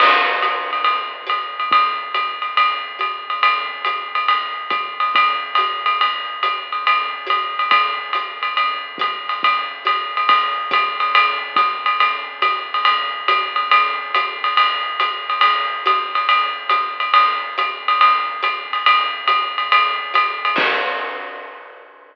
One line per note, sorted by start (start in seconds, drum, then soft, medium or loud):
0.00 crash loud
0.00 ride loud
0.42 hi-hat pedal medium
0.42 ride medium
0.73 ride medium
0.84 ride medium
1.27 hi-hat pedal medium
1.27 ride medium
1.60 ride medium
1.71 kick medium
1.71 ride loud
2.14 hi-hat pedal medium
2.14 ride medium
2.42 ride medium
2.57 ride loud
2.99 hi-hat pedal medium
2.99 ride medium
3.30 ride medium
3.43 ride loud
3.85 hi-hat pedal medium
3.85 ride medium
4.15 ride medium
4.28 ride loud
4.70 kick medium
4.70 hi-hat pedal medium
4.70 ride medium
5.00 ride medium
5.15 kick medium
5.15 ride loud
5.55 hi-hat pedal medium
5.55 ride loud
5.86 ride medium
6.01 ride loud
6.43 hi-hat pedal medium
6.43 ride medium
6.72 ride medium
6.87 ride loud
7.27 hi-hat pedal medium
7.27 ride medium
7.59 ride medium
7.71 kick medium
7.71 ride loud
8.13 hi-hat pedal medium
8.13 ride medium
8.43 ride medium
8.57 ride medium
8.98 kick medium
8.98 hi-hat pedal medium
8.98 ride medium
9.29 ride medium
9.43 kick medium
9.43 ride loud
9.85 hi-hat pedal medium
9.85 ride medium
10.17 ride medium
10.29 kick medium
10.29 ride loud
10.71 kick medium
10.71 hi-hat pedal medium
10.71 ride loud
11.00 ride medium
11.15 ride loud
11.56 kick medium
11.56 hi-hat pedal medium
11.56 ride loud
11.86 ride medium
12.00 ride loud
12.42 hi-hat pedal medium
12.42 ride loud
12.74 ride medium
12.85 ride loud
13.28 hi-hat pedal loud
13.28 ride loud
13.56 ride medium
13.71 ride loud
14.14 hi-hat pedal medium
14.14 ride medium
14.44 ride medium
14.57 ride loud
15.00 hi-hat pedal medium
15.00 ride medium
15.30 ride medium
15.41 ride loud
15.86 hi-hat pedal loud
15.86 ride medium
16.15 ride medium
16.29 ride loud
16.69 hi-hat pedal medium
16.69 ride medium
17.00 ride medium
17.14 ride loud
17.58 hi-hat pedal medium
17.58 ride medium
17.88 ride medium
18.01 ride loud
18.42 hi-hat pedal medium
18.42 ride medium
18.73 ride medium
18.86 ride loud
19.27 hi-hat pedal medium
19.27 ride loud
19.58 ride medium
19.72 ride loud
20.14 hi-hat pedal medium
20.14 ride loud
20.45 ride medium
20.56 kick loud
20.56 crash loud